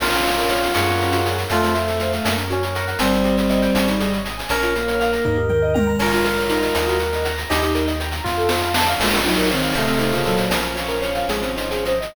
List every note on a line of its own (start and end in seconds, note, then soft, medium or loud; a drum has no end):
0.00 0.68 A#1 medium
0.00 0.11 A#3 loud
0.00 1.16 C#4 medium
0.00 1.27 F4 loud
0.00 0.22 A#4 medium
0.00 crash loud
0.00 cowbell medium
0.12 0.24 C#4 medium
0.12 shaker medium
0.25 0.36 F4 medium
0.25 0.47 C#5 medium
0.25 shaker medium
0.37 0.49 A#4 medium
0.37 shaker medium
0.48 0.61 C#5 medium
0.48 0.72 F5 medium
0.48 shaker medium
0.63 0.74 F5 medium
0.63 shaker medium
0.74 1.45 F#2 medium
0.74 0.86 G#3 loud
0.74 1.42 G#4 medium
0.74 1.42 A#4 medium
0.74 1.42 C#5 loud
0.74 1.42 F#5 loud
0.74 cowbell medium
0.74 shaker loud
0.88 0.99 A#3 medium
0.88 shaker medium
1.00 1.11 C#4 medium
1.00 shaker medium
1.12 1.24 F#4 medium
1.12 shaker loud
1.26 1.37 G#4 medium
1.26 shaker medium
1.37 1.49 A#4 medium
1.37 shaker medium
1.49 2.19 F2 medium
1.49 2.35 A3 medium
1.49 1.61 A3 loud
1.49 1.76 F4 loud
1.49 1.72 A4 medium
1.49 cowbell loud
1.49 shaker loud
1.62 1.73 C4 medium
1.62 shaker medium
1.74 2.15 A3 loud
1.74 1.86 F4 medium
1.74 1.98 C5 medium
1.74 shaker medium
1.88 1.99 A4 medium
1.88 shaker medium
1.99 2.12 C5 medium
1.99 2.23 F5 medium
1.99 shaker medium
2.13 2.24 F5 medium
2.13 shaker medium
2.25 2.94 F#2 medium
2.25 2.37 A#3 loud
2.25 2.48 A#4 medium
2.25 cowbell medium
2.25 shaker loud
2.37 2.49 C#4 medium
2.37 shaker medium
2.50 2.74 C#4 loud
2.50 2.61 F#4 medium
2.50 2.73 C#5 medium
2.50 shaker medium
2.63 2.74 A#4 medium
2.63 shaker medium
2.75 2.99 A#4 medium
2.75 2.86 C#5 medium
2.75 2.98 F#5 medium
2.75 shaker medium
2.87 2.99 F#5 medium
2.87 shaker medium
2.99 3.68 G1 medium
2.99 4.18 G3 medium
2.99 3.86 C4 loud
2.99 3.11 C4 loud
2.99 3.23 C5 loud
2.99 cowbell loud
2.99 shaker loud
3.12 3.24 D#4 medium
3.12 shaker medium
3.24 3.36 G4 medium
3.24 3.48 D#5 medium
3.24 shaker medium
3.37 3.49 C5 medium
3.37 shaker medium
3.49 3.61 D#5 medium
3.49 3.73 G5 medium
3.49 shaker medium
3.62 3.74 G5 loud
3.62 shaker medium
3.74 4.44 G#1 medium
3.74 3.87 C#4 medium
3.74 3.97 C#5 medium
3.74 cowbell medium
3.74 shaker loud
3.88 3.99 D#4 medium
3.88 shaker medium
4.00 4.11 G#4 medium
4.00 4.23 D#5 medium
4.00 shaker medium
4.13 4.24 C#5 medium
4.13 shaker medium
4.25 4.36 D#5 medium
4.25 4.47 G#5 medium
4.25 shaker medium
4.38 4.49 G#5 medium
4.38 shaker medium
4.49 5.19 A#1 medium
4.49 4.61 C#4 medium
4.49 4.71 C#4 loud
4.49 5.94 A#4 loud
4.49 4.72 C#5 medium
4.49 cowbell loud
4.49 shaker loud
4.62 4.74 F4 medium
4.62 shaker medium
4.75 5.37 A#3 medium
4.75 4.87 A#4 medium
4.75 4.98 F5 medium
4.75 shaker medium
4.88 4.99 C#5 medium
4.88 shaker medium
5.00 5.11 F5 medium
5.00 5.23 A#5 medium
5.00 shaker medium
5.13 5.24 A#5 medium
5.13 shaker medium
5.25 5.94 D#2 medium
5.25 5.36 D#4 loud
5.25 5.48 D#5 medium
5.25 kick medium
5.25 floor tom medium
5.37 5.49 G4 medium
5.49 5.62 A#4 medium
5.49 5.72 G5 medium
5.49 mid tom medium
5.62 5.74 D#5 medium
5.74 5.86 G5 medium
5.74 5.97 A#5 medium
5.74 high tom loud
5.87 5.98 A#5 medium
5.99 6.69 A#1 medium
5.99 6.12 C#4 loud
5.99 7.01 F4 medium
5.99 7.27 A#4 loud
5.99 6.23 C#5 medium
5.99 crash loud
5.99 cowbell loud
6.12 6.24 F4 medium
6.12 shaker medium
6.25 6.36 A#4 medium
6.25 6.48 F5 medium
6.25 shaker medium
6.38 6.49 C#5 medium
6.38 shaker medium
6.49 6.86 D#4 loud
6.49 6.72 A#5 medium
6.49 shaker medium
6.62 shaker medium
6.74 7.44 D#2 medium
6.74 6.98 D#5 medium
6.74 cowbell medium
6.74 shaker loud
6.88 6.99 F#4 medium
6.88 shaker medium
6.99 7.11 A#4 medium
6.99 7.22 F#5 medium
6.99 shaker medium
7.12 7.24 D#5 medium
7.12 shaker medium
7.25 7.36 F#5 medium
7.25 7.48 A#5 medium
7.25 shaker medium
7.38 7.49 A#5 medium
7.38 shaker medium
7.50 8.20 D#2 medium
7.50 7.61 D#4 loud
7.50 7.92 D#4 medium
7.50 7.73 G4 loud
7.50 7.72 D#5 loud
7.50 cowbell loud
7.50 shaker loud
7.62 7.74 G4 medium
7.62 shaker medium
7.75 7.86 A#4 medium
7.75 7.98 G5 medium
7.75 shaker medium
7.87 7.99 D#5 medium
7.87 shaker medium
8.00 8.12 G5 medium
8.00 8.23 A#5 medium
8.00 shaker medium
8.12 8.24 A#5 medium
8.12 shaker medium
8.24 8.94 F2 medium
8.24 8.72 F4 loud
8.24 8.36 F4 loud
8.24 8.48 F5 medium
8.24 kick medium
8.24 snare medium
8.37 8.49 A4 medium
8.49 8.61 C5 medium
8.49 8.73 A5 medium
8.49 snare loud
8.62 8.73 F5 medium
8.74 8.86 A5 medium
8.74 8.97 C6 medium
8.74 snare loud
8.88 8.99 F5 medium
8.99 9.68 A#1 medium
8.99 9.20 G#3 medium
8.99 9.11 A#3 loud
8.99 9.20 F4 medium
8.99 9.22 A#4 medium
8.99 crash loud
8.99 cowbell loud
9.11 9.24 C#4 medium
9.11 shaker medium
9.25 9.49 F#3 medium
9.25 9.49 D#4 medium
9.25 9.36 F4 medium
9.25 9.48 C#5 medium
9.25 shaker medium
9.37 9.49 A#4 medium
9.37 shaker medium
9.50 9.74 D#3 medium
9.50 9.74 C4 medium
9.50 9.61 C#5 medium
9.50 9.72 F5 medium
9.50 shaker medium
9.62 9.74 F5 medium
9.62 shaker medium
9.73 10.44 A1 medium
9.73 10.11 C3 medium
9.73 10.11 A3 medium
9.73 9.86 A3 loud
9.73 10.43 A4 medium
9.73 10.43 C5 loud
9.73 10.43 D#5 medium
9.73 10.43 F5 medium
9.73 cowbell medium
9.73 shaker medium
9.87 9.98 C4 medium
9.87 shaker medium
9.99 10.11 D#4 medium
9.99 shaker medium
10.12 10.24 C#3 medium
10.12 10.24 A#3 medium
10.12 10.24 F4 medium
10.12 shaker medium
10.25 10.49 A#2 medium
10.25 10.49 F#3 medium
10.25 10.36 A4 medium
10.25 shaker medium
10.37 10.49 C5 medium
10.37 shaker medium
10.50 11.22 A#1 medium
10.50 11.90 F3 medium
10.50 10.61 A#3 loud
10.50 11.90 C#4 medium
10.50 10.73 A#4 medium
10.50 cowbell loud
10.50 shaker loud
10.62 10.74 C#4 medium
10.62 shaker medium
10.75 10.87 F4 medium
10.75 10.99 C#5 medium
10.75 shaker medium
10.88 11.00 A#4 medium
10.88 shaker medium
11.01 11.14 C#5 medium
11.01 11.25 F5 medium
11.01 shaker medium
11.15 11.27 F5 medium
11.15 shaker medium
11.29 12.08 G#1 medium
11.29 11.41 G#3 loud
11.29 11.55 G#4 medium
11.29 cowbell medium
11.29 shaker loud
11.42 11.56 C4 medium
11.42 shaker medium
11.56 11.69 D#4 medium
11.56 11.82 C5 medium
11.56 shaker medium
11.71 11.84 G#4 medium
11.71 shaker medium
11.85 11.99 C5 medium
11.85 12.12 D#5 medium
11.85 shaker medium
12.01 12.14 D#5 medium
12.01 shaker medium